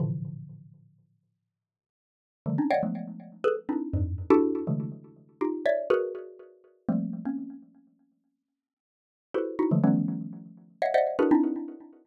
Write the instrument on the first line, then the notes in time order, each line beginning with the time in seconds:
xylophone
0.00 A2 A#2 C3 D3 E3 F3
2.46 D3 D#3 F3 G3 A3
2.58 C4 C#4 D4 D#4
2.70 C#5 D5 D#5 F5 F#5 G5
2.83 F3 F#3 G#3 A3 B3
3.44 G#4 A4 B4
3.69 C4 D4 D#4 E4
3.93 F2 G2 G#2
4.30 D4 E4 F#4 G4 A4
4.67 C3 D3 E3 F#3 G#3 A3
5.41 D#4 F4 G4
5.66 C#5 D5 E5
5.90 F#4 G#4 A#4 B4
6.89 F3 G3 A3 A#3 C4
7.25 A#3 C4 C#4
9.34 E4 F#4 G4 A4 B4 C5
9.59 D#4 E4 F#4
9.71 D3 E3 F3 F#3 G#3 A3
9.84 D#3 F3 G3 A3 B3 C#4
10.82 C#5 D#5 E5 F5 F#5
10.94 C5 D5 D#5 E5 F#5
11.19 D4 E4 F#4 G#4 A#4 B4
11.31 C4 D4 D#4 E4